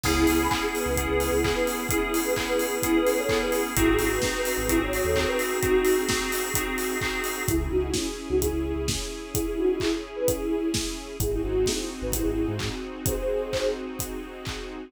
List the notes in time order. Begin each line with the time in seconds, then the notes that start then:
0.03 C#2 B3 C#4 E4 G#4, kick, crash
0.27 C#2 E4 G#4, open hi-hat
0.39 G#5 B5
0.51 B3 C#4 E4 G#4, kick, clap
0.62 E4 G#4
0.74 G#4 B4, open hi-hat
0.86 C#2
0.96 B3 C#4 E4 G#4, kick, closed hi-hat
1.09 C#2 G#4 B4
1.20 open hi-hat
1.32 C#2 E4 G#4
1.44 B3 C#4 E4 G#4, kick, clap
1.55 G#4 B4
1.67 open hi-hat
1.89 B3 C#4 E4 G#4, kick, closed hi-hat
2.13 E4 G#4, open hi-hat
2.25 G#4 B4
2.36 B3 C#4 E4 G#4, kick, clap
2.47 G#4 B4
2.59 G#4 B4, open hi-hat
2.82 B3 C#4 E4 G#4, kick, closed hi-hat
2.95 G#4 B4
3.06 open hi-hat
3.18 A4 C#5
3.29 B3 C#4 E4 G#4, kick, clap
3.41 G#4 B4
3.52 open hi-hat
3.75 G#1 C4 D#4 E4 F#4 G#4, kick, closed hi-hat
3.99 G#1 E4 G#4, open hi-hat
4.11 B4
4.22 C4 D#4 F#4 G#4, kick, snare
4.35 B4
4.45 B4, open hi-hat
4.58 G#1
4.69 C4 D#4 E4 F#4 G#4, kick, closed hi-hat
4.80 G#1 C#5
4.93 open hi-hat
5.04 D#2 A4 C#5
5.15 C4 D#4 F#4 G#4, kick, clap
5.27 B4
5.39 open hi-hat
5.62 C4 D#4 F#4 G#4, kick, closed hi-hat
5.84 open hi-hat
6.09 C4 D#4 F#4 G#4, kick, snare
6.32 open hi-hat
6.54 C4 D#4 F#4 G#4, kick, closed hi-hat
6.78 open hi-hat
7.01 C4 D#4 F#4 G#4, kick, clap
7.24 open hi-hat
7.48 C#2 C#4 E4 G#4, kick, closed hi-hat
7.60 E4 G#4
7.71 C#2 D#4 F#4
7.94 C#4 E4, kick, snare
8.29 C#2 D#4 F#4
8.41 E4 G#4, kick, closed hi-hat
8.53 C#2
8.76 C#2
8.88 kick, snare
9.34 E4 G#4, kick, closed hi-hat
9.46 E4 G#4
9.57 D#4 F#4
9.80 E4 G#4, kick, clap
10.16 G#4 B4
10.28 E4 G#4, kick, closed hi-hat
10.74 kick, snare
11.20 G#1 C4 D#4 E4 F#4 G#4, kick, closed hi-hat
11.32 E4 G#4
11.43 G#1 D#4 F#4
11.66 E4 G#4, kick, snare
12.02 G#1 B4
12.12 E4 G#4, kick, closed hi-hat
12.25 G#1
12.48 G#2
12.59 kick, clap
13.06 G#4 C5, kick, closed hi-hat
13.53 kick, clap
13.99 kick, closed hi-hat
14.45 kick, clap